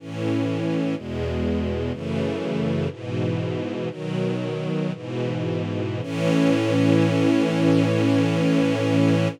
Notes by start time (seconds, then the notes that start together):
0.00 A2 E3 C#4
0.96 E2 B2 G#3
1.92 F#2 C#3 E3 A3
2.91 G#2 B2 E3
3.90 B2 D#3 F#3
4.93 G#2 B2 E3
6.02 A2 E3 C#4